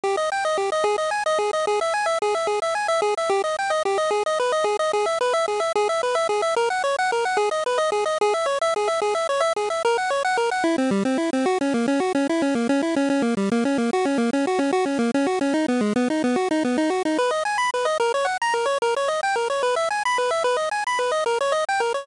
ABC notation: X:1
M:6/8
L:1/8
Q:3/8=147
K:G#m
V:1 name="Lead 1 (square)"
=G d =g d G d | G d g d G d | G e g e G e | G e g e G e |
=G d =g d G d | G d B d G d | G e B e G e | G e B e G e |
A f c f A f | G d B d G d | G e c e G e | G e c e G e |
A f c f A f | E =C =G, C E C | F C A, C F C | E C A, C E C |
C A, =G, A, C A, | F C A, C F C | F C A, C F C | D B, G, B, D B, |
F D B, D F D | B d g b B d | A c f a A c | A c d =g A c |
B e g b B e | B d g b B d | A c d =g A c |]